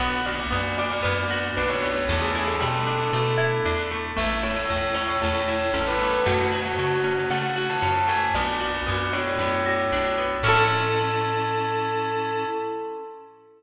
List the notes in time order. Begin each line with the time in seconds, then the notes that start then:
0.00 B1 B3 D4 F#4 F#5
0.26 B3 D4 F#4 D5
0.39 B3 D4 F#4 D5
0.51 F#2 B3 D4 F#4
0.78 D4 D5
0.91 B3 D4 F#4 D5
1.03 F#2 B3 D4 F#4 D5
1.30 B3 D4 F#4
1.57 B1 D4 B4
1.69 B3 D4 F#4 C#5
1.82 B3
1.96 C#5
2.09 E2 A3 B3 D4 E4 A4
2.22 G#4
2.35 A3 B3 D4 E4
2.48 A3 B3 D4 E4 A4
2.60 B2 G3 A3 B3 D4 E4
2.87 D4
2.99 A3 B3 D4 E4
3.13 B2 A3 B3 D4 E4
3.37 A3 B3 D4 E4
3.65 E2 D4
3.79 A3 B3 D4 E4
3.91 A3
4.16 A1 A3 C#4 E4 E5
4.42 A3 C#4 E4 C#5
4.56 A3 C#4 E4 C#5
4.69 E2 A3 C#4 E4
4.94 C#4 C#5
5.09 A3 C#4 E4 C#5
5.22 E2 A3 C#4 E4 C#5
5.48 A3 C#4 E4
5.73 A1 C#4 A4
5.87 A3 C#4 E4 B4
6.02 A3
6.13 B4
6.25 F#2 A3 C#4 F#4
6.52 A3 C#4 F#4
6.65 A3 C#4 F#4
6.79 C#3 A3 C#4 F#4
7.04 C#4
7.18 A3 C#4 F#4
7.30 C#3 A3 C#4 F#4 F#5
7.56 A3 C#4 F#4
7.70 A5
7.82 F#2 C#4
7.95 A3 C#4 F#4
8.08 A3 G#5
8.35 B1 B3 D4 F#4 D5
8.60 B3 D4 F#4
8.74 B3 D4 F#4
8.86 F#2 B3 D4 F#4
9.13 D4 C#5
9.27 B3 D4 F#4
9.39 F#2 B3 D4 F#4
9.65 B3 D4 F#4
9.92 B1 D4
10.04 B3 D4 F#4
10.18 B3
10.43 A2 C#4 E4 A4
10.48 A4